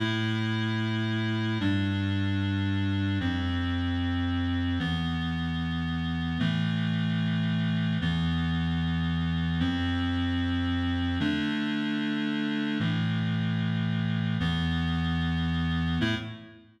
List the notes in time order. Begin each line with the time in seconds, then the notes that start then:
0.00 A2 A3 E4
1.60 G2 G3 D4
3.20 F2 F3 C4
4.79 E2 E3 B3
6.39 A2 E3 A3
8.01 E2 E3 B3
9.60 F2 F3 C4
11.20 D3 A3 D4
12.80 A2 E3 A3
14.40 E2 E3 B3
16.01 A2 A3 E4